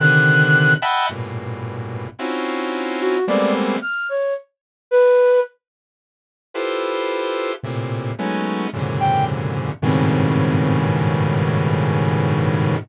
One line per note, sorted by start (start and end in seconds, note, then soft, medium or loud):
0.00 0.74 C3 medium
0.00 0.74 D3 medium
0.00 0.74 D#3 medium
0.00 0.74 F#6 medium
0.82 1.06 D#5 medium
0.82 1.06 E5 medium
0.82 1.06 F#5 medium
0.82 1.06 G5 medium
0.82 1.06 A5 medium
0.82 1.06 B5 medium
1.09 2.07 G2 soft
1.09 2.07 A2 soft
1.09 2.07 A#2 soft
1.09 2.07 B2 soft
2.19 3.17 C4 medium
2.19 3.17 C#4 medium
2.19 3.17 D#4 medium
2.19 3.17 E4 medium
2.19 3.17 F4 medium
2.19 3.17 F#4 medium
3.00 3.25 F#4 medium
3.27 3.77 G3 medium
3.27 3.77 G#3 medium
3.27 3.77 A3 medium
3.27 3.77 A#3 medium
3.27 3.77 B3 medium
3.27 3.77 C4 medium
3.27 3.52 D5 medium
3.82 4.06 F6 medium
4.09 4.34 C#5 medium
4.91 5.40 B4 loud
6.54 7.52 E4 medium
6.54 7.52 F4 medium
6.54 7.52 G4 medium
6.54 7.52 A4 medium
6.54 7.52 B4 medium
6.54 7.52 C5 medium
7.63 8.12 A2 medium
7.63 8.12 A#2 medium
7.63 8.12 C3 medium
8.18 8.67 F#3 medium
8.18 8.67 G#3 medium
8.18 8.67 A3 medium
8.18 8.67 B3 medium
8.18 8.67 C#4 medium
8.18 8.67 D#4 medium
8.73 9.71 F#2 medium
8.73 9.71 G#2 medium
8.73 9.71 A#2 medium
8.73 9.71 C3 medium
8.73 9.71 C#3 medium
8.73 9.71 D3 medium
9.00 9.25 G5 medium
9.82 12.77 G2 medium
9.82 12.77 G#2 medium
9.82 12.77 A2 medium
9.82 12.77 B2 medium
9.82 12.77 C#3 medium
9.82 12.77 D#3 medium
9.82 10.80 C4 medium